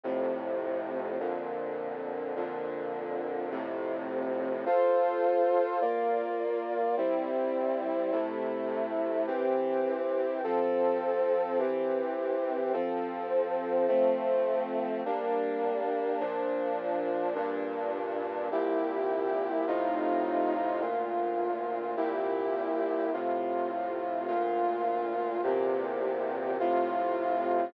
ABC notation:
X:1
M:4/4
L:1/8
Q:1/4=52
K:F
V:1 name="Brass Section"
[F,,A,,C,]2 [F,,B,,D,]2 [F,,B,,D,]2 [F,,A,,C,]2 | [FAc]2 [B,Fd]2 [G,CE]2 [C,A,E]2 | [E,CG]2 [F,CA]2 [E,CG]2 [F,CA]2 | [F,A,C]2 [G,B,D]2 [B,,F,D]2 [G,,B,,D]2 |
[C,,B,,EG]2 [A,,C,_EF]2 [D,,B,,F]2 [C,,B,,=EG]2 | [A,,C,F]2 [D,,B,,F]2 [E,,B,,C,G]2 [A,,C,F]2 |]